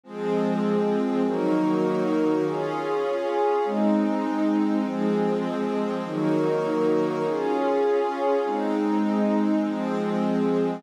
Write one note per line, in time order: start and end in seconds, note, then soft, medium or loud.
0.04 1.22 F3 medium
0.04 1.23 F3 medium
0.04 1.22 G#3 medium
0.04 1.22 C4 medium
0.04 1.23 C4 medium
0.04 1.23 G#4 medium
1.24 2.43 D#3 medium
1.24 2.43 F#3 medium
1.24 2.43 A#3 medium
1.24 2.43 D#4 loud
1.24 2.43 F#4 medium
1.24 2.43 A#4 medium
2.44 3.62 C#4 loud
2.44 3.63 C#4 medium
2.44 3.62 F4 medium
2.44 3.62 G#4 medium
2.44 3.63 G#4 medium
2.44 3.63 F5 medium
3.64 4.83 G#3 medium
3.64 4.82 G#3 medium
3.64 4.83 C4 medium
3.64 4.82 C4 medium
3.64 4.83 D#4 medium
4.83 6.01 F3 medium
4.83 6.03 F3 medium
4.83 6.01 G#3 medium
4.83 6.01 C4 medium
4.83 6.03 C4 medium
4.83 6.03 G#4 medium
6.03 7.22 D#3 medium
6.03 7.22 F#3 medium
6.03 7.22 A#3 medium
6.03 7.23 D#4 loud
6.03 7.23 F#4 medium
6.03 7.23 A#4 medium
7.24 8.43 C#4 medium
7.24 8.43 C#4 loud
7.24 8.43 F4 medium
7.24 8.43 G#4 medium
7.24 8.43 F5 medium
8.44 9.63 G#3 medium
8.44 9.62 G#3 medium
8.44 9.63 C4 medium
8.44 9.62 C4 medium
8.44 9.63 D#4 medium
8.44 9.64 D#4 medium
9.62 10.81 F3 medium
9.62 10.83 F3 medium
9.62 10.81 G#3 medium
9.62 10.81 C4 medium
9.62 10.83 C4 medium
9.62 10.83 G#4 medium